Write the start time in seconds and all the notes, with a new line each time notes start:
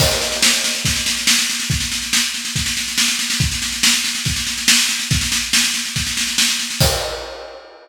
0.00 kick, snare, crash
0.11 snare
0.21 snare
0.32 snare
0.42 snare
0.53 snare
0.64 snare
0.75 snare
0.85 kick, snare
0.95 snare
1.06 snare
1.17 snare
1.27 snare
1.38 snare
1.50 snare
1.60 snare
1.70 kick, snare
1.80 snare
1.92 snare
2.02 snare
2.13 snare
2.34 snare
2.45 snare
2.56 kick, snare
2.66 snare
2.77 snare
2.88 snare
2.98 snare
3.08 snare
3.19 snare
3.30 snare
3.40 kick, snare
3.52 snare
3.62 snare
3.72 snare
3.83 snare
3.94 snare
4.04 snare
4.15 snare
4.25 kick, snare
4.36 snare
4.47 snare
4.58 snare
4.68 snare
4.79 snare
4.89 snare
4.99 snare
5.11 kick, snare
5.21 snare
5.32 snare
5.53 snare
5.64 snare
5.74 snare
5.85 snare
5.96 kick, snare
6.07 snare
6.17 snare
6.27 snare
6.38 snare
6.49 snare
6.59 snare
6.70 snare
6.80 kick, crash